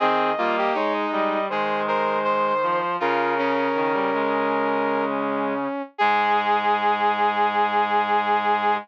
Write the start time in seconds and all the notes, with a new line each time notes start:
0.00 D#3 C4 G#4 D#5
0.38 G3 A#3 F4
0.58 G4
0.74 G#3 D#4 C#5
0.93 D#5
1.12 G3 D#5
1.49 D#3 G#3 G#4 C5
1.88 A#4 C5
2.24 C5
2.63 F3
3.00 C#3 F4 A#4
3.38 C#4
3.75 D#3
3.93 G3
4.13 G#3
5.98 G#2 G#3 G#4